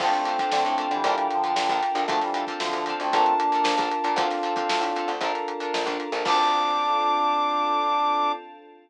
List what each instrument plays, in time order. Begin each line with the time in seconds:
0.00 electric bass (finger) D2, brass section F3 A3 G5, pad 5 (bowed) C4 D4 F4 A4, electric piano 1 C4 D4 F4 A4, acoustic guitar (steel) D4 F4 A4 C5, kick, crash
0.13 brass section A3 C4, snare, closed hi-hat
0.25 acoustic guitar (steel) D4 F4 A4 C5, closed hi-hat
0.39 acoustic guitar (steel) D4 F4 A4 C5, kick, snare, closed hi-hat
0.52 electric bass (finger) D3, brass section A3 C4, snare
0.65 electric bass (finger) A2, closed hi-hat
0.78 acoustic guitar (steel) D4 F4 A4 C5, closed hi-hat
0.91 electric bass (finger) D3, brass section E3 G3, closed hi-hat
1.04 electric bass (finger) A#1, acoustic guitar (steel) D4 F4 A4 A#4, electric piano 1 D4 F4 A4 A#4, pad 5 (bowed) D4 F4 A4 A#4, kick, closed hi-hat
1.18 closed hi-hat
1.30 brass section D3 F3, snare, closed hi-hat
1.44 acoustic guitar (steel) D4 F4 A4 A#4, closed hi-hat
1.56 electric bass (finger) A#1, snare
1.69 electric bass (finger) A#1, acoustic guitar (steel) D4 F4 A4 A#4, kick, snare, closed hi-hat
1.82 snare, closed hi-hat
1.95 electric bass (finger) A#1, acoustic guitar (steel) D4 F4 A4 A#4, closed hi-hat
2.08 electric bass (finger) D2, brass section F3 A3, electric piano 1 C4 D4 F4 A4, pad 5 (bowed) C4 D4 F4 A4, acoustic guitar (steel) C4 D4 F4, kick, closed hi-hat
2.12 acoustic guitar (steel) A4
2.22 brass section E3 G3, snare, closed hi-hat
2.34 acoustic guitar (steel) C4 D4 F4 A4, closed hi-hat
2.47 acoustic guitar (steel) C4 D4 F4 A4, kick, closed hi-hat
2.60 electric bass (finger) D2, brass section D3 F3, snare
2.73 electric bass (finger) D2, closed hi-hat
2.86 acoustic guitar (steel) C4 D4 F4, closed hi-hat
2.90 acoustic guitar (steel) A4
3.00 electric bass (finger) D2, brass section A3 C4, closed hi-hat
3.13 electric bass (finger) A#1, acoustic guitar (steel) D4 F4 A4 A#4, pad 5 (bowed) D4 F4 A4 A#4, electric piano 1 D4 F4 A4 A#4, brass section A5, kick, closed hi-hat
3.26 closed hi-hat
3.39 brass section A#3 D4, closed hi-hat
3.52 acoustic guitar (steel) D4 F4 A4 A#4, snare, closed hi-hat
3.64 electric bass (finger) A#1, snare
3.77 electric bass (finger) A#1, acoustic guitar (steel) D4 F4 A4 A#4, kick, closed hi-hat
3.92 closed hi-hat
4.04 electric bass (finger) A#2, acoustic guitar (steel) D4 F4 A4 A#4, closed hi-hat
4.16 electric bass (finger) D2, electric piano 1 C4 D4 F4 A4, pad 5 (bowed) C4 D4 F4 A4, acoustic guitar (steel) C4 D4 F4, brass section D4 F4, kick, closed hi-hat
4.21 acoustic guitar (steel) A4
4.30 snare, closed hi-hat
4.43 acoustic guitar (steel) C4 D4 F4 A4, closed hi-hat
4.56 acoustic guitar (steel) C4 D4 F4 A4, kick, closed hi-hat
4.69 electric bass (finger) D2, snare
4.81 electric bass (finger) A2, closed hi-hat
4.96 acoustic guitar (steel) C4 D4 F4 A4, closed hi-hat
5.08 electric bass (finger) D2, closed hi-hat
5.21 electric bass (finger) A#1, electric piano 1 D4 F4 A4 A#4, pad 5 (bowed) D4 F4 A4 A#4, acoustic guitar (steel) D4 F4 A4, kick, closed hi-hat
5.25 acoustic guitar (steel) A#4
5.35 snare, closed hi-hat
5.48 closed hi-hat
5.60 acoustic guitar (steel) D4 F4 A4 A#4, closed hi-hat
5.74 electric bass (finger) A#1, snare
5.86 electric bass (finger) A#1, acoustic guitar (steel) D4 F4 A4 A#4, kick, closed hi-hat
6.00 closed hi-hat
6.12 electric bass (finger) A#1, acoustic guitar (steel) D4 F4 A4 A#4, closed hi-hat
6.25 electric bass (finger) D2, electric piano 1 C4 D4 F4 A4, pad 5 (bowed) C4 D4 F4 A4, acoustic guitar (steel) D4 F4 A4 C5, brass section D4 D6, kick, crash